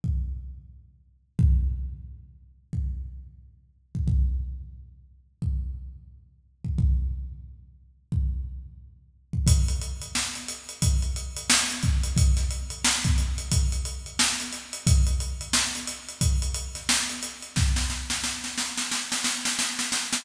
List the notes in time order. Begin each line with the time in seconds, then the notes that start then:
0.04 kick
1.39 kick
2.73 kick
3.95 kick
4.08 kick
5.42 kick
6.64 kick
6.78 kick
8.12 kick
9.33 kick
9.47 kick, closed hi-hat
9.68 closed hi-hat
9.81 closed hi-hat
10.02 closed hi-hat
10.15 snare
10.35 closed hi-hat
10.48 closed hi-hat
10.69 closed hi-hat
10.82 kick, closed hi-hat
11.02 closed hi-hat
11.16 closed hi-hat
11.37 closed hi-hat
11.50 snare
11.70 closed hi-hat
11.83 kick, closed hi-hat
12.04 closed hi-hat
12.17 kick, closed hi-hat
12.37 snare, closed hi-hat
12.51 closed hi-hat
12.70 closed hi-hat
12.84 snare
13.04 kick, closed hi-hat
13.18 closed hi-hat
13.38 closed hi-hat
13.52 kick, closed hi-hat
13.72 closed hi-hat
13.85 closed hi-hat
14.06 closed hi-hat
14.19 snare
14.40 closed hi-hat
14.52 snare, closed hi-hat
14.73 closed hi-hat
14.87 kick, closed hi-hat
15.07 closed hi-hat
15.20 closed hi-hat
15.41 closed hi-hat
15.53 snare
15.75 closed hi-hat
15.87 closed hi-hat
16.09 closed hi-hat
16.21 kick, closed hi-hat
16.42 closed hi-hat
16.54 closed hi-hat
16.75 snare, closed hi-hat
16.89 snare
17.09 closed hi-hat
17.22 snare, closed hi-hat
17.42 closed hi-hat
17.56 kick, snare
17.76 snare
17.90 snare
18.10 snare
18.24 snare
18.44 snare
18.58 snare
18.78 snare
18.91 snare
19.12 snare
19.24 snare
19.45 snare
19.59 snare
19.79 snare
19.92 snare
20.13 snare